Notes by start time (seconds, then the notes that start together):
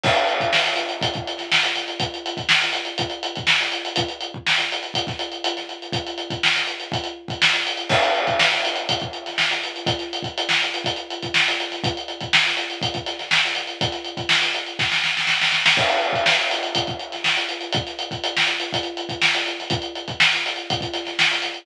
0.03 kick, crash
0.14 closed hi-hat
0.27 closed hi-hat
0.40 kick, closed hi-hat
0.53 snare
0.64 snare, closed hi-hat
0.76 snare, closed hi-hat
0.89 closed hi-hat
1.01 kick, closed hi-hat
1.14 kick, closed hi-hat
1.27 closed hi-hat
1.38 snare, closed hi-hat
1.52 snare
1.63 closed hi-hat
1.75 snare, closed hi-hat
1.88 closed hi-hat
2.00 kick, closed hi-hat
2.14 closed hi-hat
2.26 closed hi-hat
2.37 kick, closed hi-hat
2.49 snare
2.61 snare, closed hi-hat
2.73 closed hi-hat
2.85 closed hi-hat
2.98 kick, closed hi-hat
3.10 closed hi-hat
3.23 closed hi-hat
3.35 kick, closed hi-hat
3.47 snare
3.61 closed hi-hat
3.72 closed hi-hat
3.85 closed hi-hat
3.96 kick, closed hi-hat
4.09 closed hi-hat
4.21 closed hi-hat
4.34 kick
4.47 snare
4.58 snare, closed hi-hat
4.72 closed hi-hat
4.83 closed hi-hat
4.94 kick, closed hi-hat
5.07 kick, snare, closed hi-hat
5.19 closed hi-hat
5.32 closed hi-hat
5.44 closed hi-hat
5.57 snare, closed hi-hat
5.69 closed hi-hat
5.82 closed hi-hat
5.92 kick, closed hi-hat
6.07 closed hi-hat
6.18 closed hi-hat
6.30 kick, closed hi-hat
6.43 snare
6.55 snare, closed hi-hat
6.67 closed hi-hat
6.80 closed hi-hat
6.92 kick, closed hi-hat
7.04 closed hi-hat
7.28 kick, closed hi-hat
7.42 snare
7.53 closed hi-hat
7.67 closed hi-hat
7.77 closed hi-hat
7.89 kick, crash
8.03 closed hi-hat
8.15 closed hi-hat
8.27 kick, closed hi-hat
8.39 snare
8.51 snare, closed hi-hat
8.65 closed hi-hat
8.76 closed hi-hat
8.89 kick, closed hi-hat
9.00 kick, closed hi-hat
9.13 closed hi-hat
9.26 snare, closed hi-hat
9.38 snare
9.51 snare, closed hi-hat
9.64 closed hi-hat
9.76 closed hi-hat
9.86 kick, closed hi-hat
9.99 snare, closed hi-hat
10.13 closed hi-hat
10.22 kick, closed hi-hat
10.38 closed hi-hat
10.49 snare
10.62 closed hi-hat
10.74 closed hi-hat
10.84 kick, closed hi-hat
10.96 closed hi-hat
11.10 closed hi-hat
11.22 kick, closed hi-hat
11.34 snare
11.48 closed hi-hat
11.60 closed hi-hat
11.70 snare, closed hi-hat
11.84 kick, closed hi-hat
11.97 closed hi-hat
12.08 closed hi-hat
12.20 kick, closed hi-hat
12.33 snare
12.46 snare, closed hi-hat
12.57 closed hi-hat
12.70 closed hi-hat
12.81 kick, closed hi-hat
12.94 kick, closed hi-hat
13.06 snare, closed hi-hat
13.19 snare, closed hi-hat
13.31 snare
13.45 closed hi-hat
13.55 snare, closed hi-hat
13.67 closed hi-hat
13.81 kick, closed hi-hat
13.92 snare, closed hi-hat
14.05 closed hi-hat
14.17 kick, closed hi-hat
14.29 snare
14.41 snare, closed hi-hat
14.54 closed hi-hat
14.66 closed hi-hat
14.79 kick, snare
14.92 snare
15.04 snare
15.17 snare
15.27 snare
15.41 snare
15.52 snare
15.66 snare
15.77 kick, crash
15.89 closed hi-hat
16.01 closed hi-hat
16.13 kick, closed hi-hat
16.26 snare
16.38 snare, closed hi-hat
16.51 closed hi-hat
16.63 closed hi-hat
16.75 kick, closed hi-hat
16.87 kick, closed hi-hat
16.99 closed hi-hat
17.12 snare, closed hi-hat
17.24 snare
17.37 snare, closed hi-hat
17.49 closed hi-hat
17.61 closed hi-hat
17.72 kick, closed hi-hat
17.87 snare, closed hi-hat
17.99 closed hi-hat
18.11 kick, closed hi-hat
18.24 closed hi-hat
18.37 snare
18.47 closed hi-hat
18.60 closed hi-hat
18.73 kick, closed hi-hat
18.83 closed hi-hat
18.97 closed hi-hat
19.09 kick, closed hi-hat
19.22 snare
19.35 closed hi-hat
19.46 closed hi-hat
19.59 snare, closed hi-hat
19.70 kick, closed hi-hat
19.82 closed hi-hat
19.95 closed hi-hat
20.08 kick, closed hi-hat
20.20 snare
20.32 snare, closed hi-hat
20.46 closed hi-hat
20.56 closed hi-hat
20.70 kick, closed hi-hat
20.81 kick, closed hi-hat
20.94 snare, closed hi-hat
21.05 snare, closed hi-hat
21.19 snare
21.31 closed hi-hat
21.42 snare, closed hi-hat
21.54 closed hi-hat